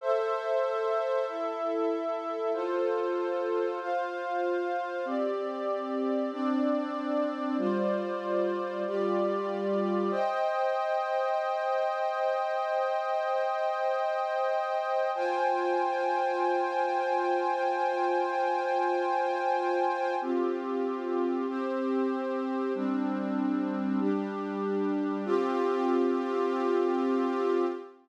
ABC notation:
X:1
M:4/4
L:1/8
Q:1/4=95
K:C
V:1 name="Pad 2 (warm)"
[Ace]4 [EAe]4 | [FAc]4 [Fcf]4 | [CGd]4 [CDd]4 | [G,Fcd]4 [G,FGd]4 |
[K:Cm] [ceg]8- | [ceg]8 | [Fcga]8- | [Fcga]8 |
[K:C] [CFG]4 [CGc]4 | [G,CD]4 [G,DG]4 | [CFG]8 |]